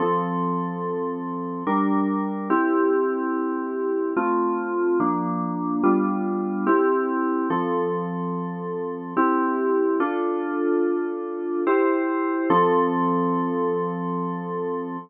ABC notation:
X:1
M:3/4
L:1/8
Q:1/4=72
K:F
V:1 name="Electric Piano 2"
[F,CA]4 [G,DB]2 | [CEG]4 [A,CF]2 | [F,B,D]2 [G,=B,DF]2 [CEG]2 | [F,CA]4 [CEG]2 |
[DFA]4 [EGc]2 | [F,CA]6 |]